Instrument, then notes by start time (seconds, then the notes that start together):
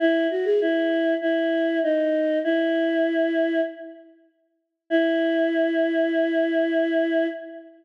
choir aahs
0.00 E4
0.31 F#4
0.45 G#4
0.61 E4
1.22 E4
1.83 D#4
2.44 E4
4.90 E4